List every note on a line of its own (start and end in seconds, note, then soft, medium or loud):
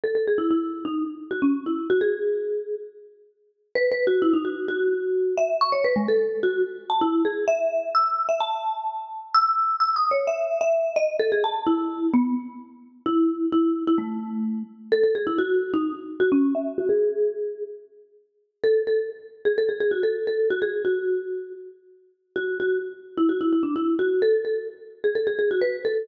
0.04 0.15 A4 medium
0.15 0.26 A4 medium
0.28 0.39 G#4 medium
0.38 0.49 E4 medium
0.51 0.84 E4 medium
0.85 1.04 D#4 medium
1.31 1.42 F#4 medium
1.42 1.64 C#4 medium
1.66 1.88 E4 medium
1.90 2.01 F#4 medium
2.01 2.75 G#4 medium
3.75 3.90 B4 medium
3.92 4.06 B4 medium
4.07 4.22 F#4 medium
4.22 4.33 E4 loud
4.33 4.44 D#4 medium
4.45 4.67 F#4 medium
4.68 5.35 F#4 medium
5.37 5.57 E5 medium
5.61 5.72 C#6 loud
5.72 5.83 C#5 medium
5.84 5.95 B4 loud
5.96 6.07 G#3 loud
6.08 6.39 A4 medium
6.43 6.62 F#4 medium
6.90 7.01 A5 medium
7.01 7.23 E4 medium
7.25 7.45 G#4 medium
7.48 7.89 E5 medium
7.95 8.26 E6 medium
8.29 8.40 E5 medium
8.40 9.08 A5 medium
9.34 9.76 E6 loud
9.80 9.95 E6 medium
9.96 10.11 D#6 medium
10.11 10.26 C#5 medium
10.27 10.59 E5 medium
10.61 10.92 E5 medium
10.96 11.16 D#5 loud
11.19 11.31 A4 loud
11.32 11.43 G#4 medium
11.44 11.64 A5 medium
11.67 12.07 E4 medium
12.14 12.34 B3 loud
13.06 13.46 E4 medium
13.52 13.83 E4 medium
13.87 13.98 E4 loud
13.98 14.63 A3 medium
14.92 15.03 A4 loud
15.03 15.15 A4 medium
15.15 15.26 G#4 medium
15.27 15.38 E4 medium
15.38 15.72 F#4 medium
15.74 15.93 D#4 medium
16.20 16.31 F#4 medium
16.32 16.54 C#4 medium
16.55 16.77 E5 medium
16.78 16.89 F#4 loud
16.89 17.63 G#4 loud
18.64 18.82 A4 medium
18.87 19.10 A4 medium
19.45 19.56 G#4 medium
19.58 19.69 A4 medium
19.69 19.80 G#4 medium
19.80 19.91 G#4 medium
19.91 20.02 F#4 medium
20.03 20.26 A4 medium
20.27 20.49 A4 medium
20.50 20.61 F#4 medium
20.62 20.83 G#4 medium
20.85 21.53 F#4 medium
22.36 22.58 F#4 medium
22.60 22.79 F#4 medium
23.17 23.28 E4 medium
23.29 23.40 F#4 medium
23.41 23.52 E4 medium
23.53 23.64 E4 medium
23.63 23.74 D4 medium
23.76 23.95 E4 medium
23.99 24.22 F#4 medium
24.22 24.44 A4 medium
24.45 24.68 A4 medium
25.04 25.15 G#4 medium
25.15 25.26 A4 medium
25.27 25.38 G#4 medium
25.39 25.50 G#4 medium
25.51 25.62 F#4 medium
25.61 25.83 B4 medium
25.85 26.07 A4 medium